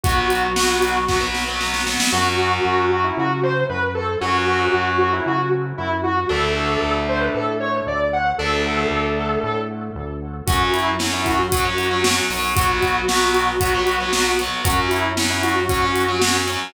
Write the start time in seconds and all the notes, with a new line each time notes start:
0.03 B1 F#3 B3 F#4, kick, closed hi-hat
0.30 closed hi-hat
0.56 F#3 B3, snare
0.82 closed hi-hat
1.08 F#3 B3, kick, snare
1.21 F#3 B3
1.35 snare
1.48 F#3 B3
1.60 F#3 B3, snare
1.74 snare
1.87 F#3 B3, snare
2.00 snare
2.12 F#2 F#3 C#4 F#4
2.65 F#2
2.91 F#4
3.04 E4
3.17 C#3 F#4
3.43 C5
3.69 F#2 B4
3.95 A4
4.21 F#2 F#3 C#4 F#4
4.74 F#2
4.98 F#4
5.13 E4
5.26 C#3 F#4
5.78 F#2 E4
6.03 F#4
6.29 D2 A3 D4 A4
6.82 D2
7.09 C5
7.20 B4
7.34 A2 A4
7.60 C#5
7.87 D2 D5
8.13 F#5
8.38 D2 A3 D4 A4
8.91 D2
9.43 A2
9.95 D2
10.47 F#2 F#3 C#4 F#4, kick, closed hi-hat
10.73 E4, closed hi-hat
10.99 F#3 C#4, snare
11.13 E4
11.26 F#4, kick, closed hi-hat
11.38 F#4
11.52 F#3 C#4, kick, closed hi-hat
11.65 F#3 C#4
11.78 closed hi-hat
11.91 F#3 C#4
12.04 F#3 C#4, snare
12.30 B1 F#3 C#4, open hi-hat
12.55 F#3 B3 F#4, kick, closed hi-hat
12.82 kick, closed hi-hat
13.08 F#3 B3, snare
13.34 closed hi-hat
13.61 F#3 B3, kick, closed hi-hat
13.74 F#3 B3
13.87 closed hi-hat
14.00 F#3 B3
14.13 F#3 B3, snare
14.39 F#3 B3, closed hi-hat
14.64 F#2 F#3 C#4 F#4, kick, closed hi-hat
14.91 E4, closed hi-hat
15.17 F#3 C#4, snare
15.30 E4
15.43 F#4, closed hi-hat
15.55 F#4
15.69 F#3 C#4, kick, closed hi-hat
15.82 F#3 C#4
15.96 closed hi-hat
16.08 F#3 C#4
16.22 F#3 C#4, snare
16.47 F#3 C#4, closed hi-hat